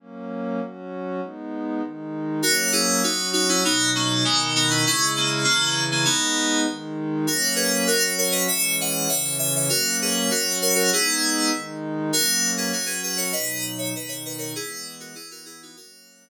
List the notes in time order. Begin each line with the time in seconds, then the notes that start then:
0.00 F#3 A#3 C#4
0.60 F#3 C#4 F#4
1.21 G#3 B3 D#4
1.82 D#3 G#3 D#4
2.42 F#3 A#3 C#4 F#4 A#4
2.72 E4 G#4
3.03 F#3 C#4 D#4 F#4
3.33 D#4 F#4
3.49 C#4 E4
3.64 B2 F#3 B3 D#4
3.95 A#3 C#4
4.24 B2 D#3 G#3 B3 D#4
4.55 B3 D#4
4.70 C#4 E4
4.85 C#3 G#3 C#4 E4
5.17 A#3 C#4
5.44 C#3 E3 A#3 C#4 E4
5.91 A#3 C#4
6.05 G#3 B3 D#4
6.67 D#3 G#3 D#4
7.27 F#3 A#3 C#4 F#4 A#4
7.56 G#4 B4
7.87 F#3 C#4 F#4 A#4
8.18 A#4 C#5
8.31 B4 D#5
8.48 E3 G#3 C#4 C#5 E5
8.81 D#5 F#5
9.09 C#3 E3 C#4 C#5 E5
9.39 E5 G#5
9.56 C#5 E5
9.69 F#3 A#3 C#4 F#4 A#4
10.02 G#4 B4
10.30 F#3 C#4 F#4 A#4
10.62 A#4 C#5
10.75 F#4 A#4
10.91 G#3 B3 D#4 E4 G#4
11.52 D#3 G#3 D#4
12.12 F#3 A#3 C#4 F#4 A#4
12.57 G#4 B4
12.73 F#3 C#4 F#4 A#4
12.86 G#4 B4
13.03 G#4 B4
13.17 A#4 C#5
13.32 B2 F#3 D#4 B4 D#5
13.78 C#5 E5
13.94 B2 D#3 D#4 B4 D#5
14.08 C#5 E5
14.25 B4 D#5
14.38 A#4 C#5
14.55 E3 G#3 B3 E4 G#4
15.00 F#4 A#4
15.15 E3 B3 E4 G#4
15.31 F#4 A#4
15.45 E4 G#4
15.63 D#4 F#4
15.76 F#3 A#3 C#4 F#4 A#4